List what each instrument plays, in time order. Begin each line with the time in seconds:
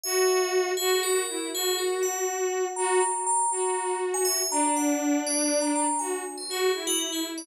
0.04 violin F#4, tubular bells E5
0.77 violin F#4, tubular bells G#4
1.03 tubular bells A#4
1.29 violin E4
1.53 violin F#4, tubular bells G#4
1.78 tubular bells A#4
2.03 tubular bells F#5
2.76 violin F#4, tubular bells A#5
3.00 tubular bells A#5
3.27 tubular bells A#5
3.52 violin F#4, tubular bells A#5
4.14 tubular bells G#5
4.25 tubular bells E5
4.51 violin D4, tubular bells A#5
4.76 tubular bells F#5
5.27 tubular bells D5
5.61 tubular bells A#5
5.76 tubular bells A#5
5.99 violin F#4, tubular bells G#5
6.38 tubular bells C5
6.49 violin F#4, tubular bells G#4
6.74 violin E4
6.87 tubular bells F#4
6.99 tubular bells F#4
7.12 tubular bells G#4
7.38 tubular bells D5